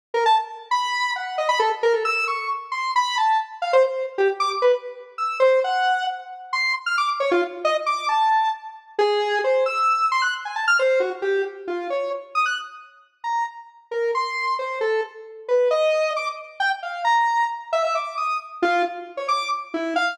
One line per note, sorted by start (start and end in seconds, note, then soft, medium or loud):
0.14 0.24 A#4 loud
0.26 0.36 A5 loud
0.71 1.11 B5 loud
1.16 1.36 F#5 medium
1.38 1.48 D#5 medium
1.49 1.59 B5 loud
1.59 1.70 A4 loud
1.83 1.93 A#4 loud
1.93 2.03 A4 medium
2.05 2.25 E6 loud
2.28 2.48 C#6 medium
2.72 2.92 C6 medium
2.96 3.16 B5 loud
3.18 3.38 A5 medium
3.62 3.72 F5 medium
3.73 3.83 C5 loud
3.84 4.04 C5 medium
4.18 4.28 G4 medium
4.40 4.50 D6 loud
4.62 4.72 B4 medium
5.18 5.38 E6 medium
5.40 5.60 C5 loud
5.64 6.04 F#5 loud
6.53 6.73 C6 medium
6.86 6.96 F6 medium
6.98 7.08 D6 medium
7.20 7.30 C#5 medium
7.31 7.42 F4 loud
7.65 7.75 D#5 loud
7.86 8.06 D6 medium
8.09 8.49 A5 medium
8.99 9.39 G#4 loud
9.44 9.64 C5 medium
9.66 10.06 E6 medium
10.12 10.22 C6 loud
10.22 10.32 F#6 medium
10.45 10.55 G#5 medium
10.56 10.66 A5 medium
10.68 10.78 F6 loud
10.79 10.99 C5 loud
11.00 11.10 F#4 medium
11.22 11.42 G4 medium
11.68 11.88 F4 medium
11.90 12.10 C#5 medium
12.35 12.45 D#6 medium
12.46 12.56 F#6 medium
13.24 13.44 A#5 medium
13.91 14.11 A#4 medium
14.15 14.55 C6 medium
14.59 14.79 C5 medium
14.81 15.01 A4 medium
15.48 15.69 B4 medium
15.71 16.11 D#5 loud
16.16 16.26 D6 medium
16.60 16.70 G5 loud
16.83 17.03 F5 medium
17.04 17.45 A#5 medium
17.73 17.83 E5 loud
17.84 17.94 E5 medium
17.95 18.15 D6 medium
18.17 18.37 D#6 medium
18.62 18.83 F4 loud
19.17 19.27 C#5 medium
19.28 19.49 D6 medium
19.74 19.94 E4 medium
19.96 20.16 F5 loud